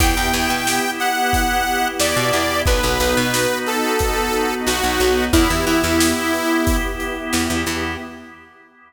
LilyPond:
<<
  \new Staff \with { instrumentName = "Lead 2 (sawtooth)" } { \time 4/4 \key e \minor \tempo 4 = 90 g''4. fis''4. d''4 | b'4. a'4. fis'4 | e'8 e'2 r4. | }
  \new Staff \with { instrumentName = "Drawbar Organ" } { \time 4/4 \key e \minor b8 e'8 g'8 e'8 b8 e'8 g'8 e'8 | b8 dis'8 fis'8 dis'8 b8 dis'8 fis'8 dis'8 | b8 e'8 g'8 e'8 b8 e'8 g'8 e'8 | }
  \new Staff \with { instrumentName = "Electric Bass (finger)" } { \clef bass \time 4/4 \key e \minor e,16 e,16 e,16 b,2~ b,16 e,16 b,16 e,8 | b,,16 b,,16 b,,16 b,2~ b,16 b,,16 b,,16 b,,8 | e,16 e,16 e16 e,2~ e,16 e,16 e,16 e,8 | }
  \new Staff \with { instrumentName = "String Ensemble 1" } { \time 4/4 \key e \minor <b e' g'>1 | <b dis' fis'>1 | <b e' g'>1 | }
  \new DrumStaff \with { instrumentName = "Drums" } \drummode { \time 4/4 <hh bd>8 hh8 sn8 hh8 <hh bd>8 hh8 sn8 hh8 | bd8 hh8 sn8 hh8 <hh bd>8 hh8 sn8 hh8 | <hh bd>8 hh8 sn8 hh8 <hh bd>8 hh8 sn8 hh8 | }
>>